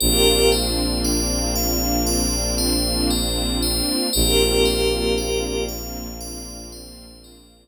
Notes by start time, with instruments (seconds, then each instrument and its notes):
0.00 violin A#1, string ensemble 1 A#3 C4 D4 F4, pad 5 (bowed) G4 A#4, tubular bells A#4
0.52 tubular bells C5
1.04 tubular bells D5
1.56 tubular bells F5
2.06 tubular bells D5
2.58 tubular bells C5
3.10 tubular bells A#4
3.63 tubular bells C5
4.13 violin A#1, string ensemble 1 A#3 C4 D4 F4, pad 5 (bowed) G4 A#4, tubular bells A#4
4.65 tubular bells C5
5.18 tubular bells D5
5.69 tubular bells F5
6.21 tubular bells D5
6.72 tubular bells C5
7.24 tubular bells A#4